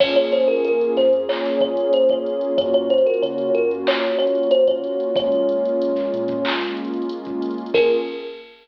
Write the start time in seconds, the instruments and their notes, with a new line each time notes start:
0.00 synth bass 2 A#1, pad 2 (warm) A#3 C#4 F4 G#4, kalimba C#5, kick, crash
0.15 synth bass 2 A#1, kalimba C#5, closed hi-hat
0.32 kalimba C5, closed hi-hat
0.40 closed hi-hat
0.48 kalimba A#4, closed hi-hat
0.56 closed hi-hat
0.65 synth bass 2 A#1, kalimba A#4, closed hi-hat
0.81 closed hi-hat
0.97 synth bass 2 F2, kalimba C5, snare, closed hi-hat
1.13 closed hi-hat
1.29 kalimba C#5, clap
1.45 snare, closed hi-hat
1.60 kalimba C#5, kick, closed hi-hat
1.77 closed hi-hat
1.93 kalimba C5, closed hi-hat
2.09 kalimba C#5, kick, closed hi-hat
2.26 closed hi-hat
2.41 closed hi-hat
2.58 synth bass 2 F#2, pad 2 (warm) A#3 C#4 F4 F#4, kalimba C#5, kick, closed hi-hat
2.74 synth bass 2 F#2, kalimba C#5, closed hi-hat
2.90 kalimba C5, closed hi-hat
2.98 closed hi-hat
3.06 kalimba A#4, closed hi-hat
3.14 closed hi-hat
3.22 synth bass 2 C#3, kalimba C#5, closed hi-hat
3.38 closed hi-hat
3.55 synth bass 2 F#2, kalimba A#4, closed hi-hat
3.71 closed hi-hat
3.87 kalimba C#5, clap
4.03 snare, closed hi-hat
4.19 kalimba C#5, closed hi-hat
4.27 closed hi-hat
4.35 closed hi-hat
4.43 closed hi-hat
4.51 kalimba C5, closed hi-hat
4.67 kalimba C#5, kick, closed hi-hat
4.84 closed hi-hat
5.00 closed hi-hat
5.15 synth bass 2 A#1, pad 2 (warm) G#3 A#3 C#4 F4, kalimba C#5, kick, closed hi-hat
5.32 synth bass 2 A#1, closed hi-hat
5.49 closed hi-hat
5.65 closed hi-hat
5.79 synth bass 2 A#1, closed hi-hat
5.96 snare, closed hi-hat
6.14 synth bass 2 A#2, closed hi-hat
6.28 kick, closed hi-hat
6.45 clap
6.61 snare, closed hi-hat
6.77 closed hi-hat
6.85 closed hi-hat
6.94 closed hi-hat
7.02 closed hi-hat
7.09 closed hi-hat
7.25 kick, closed hi-hat
7.42 closed hi-hat
7.51 closed hi-hat
7.58 closed hi-hat
7.66 closed hi-hat
7.74 synth bass 2 A#1, pad 2 (warm) A#3 C#4 F4 G#4, kalimba A#4, kick, crash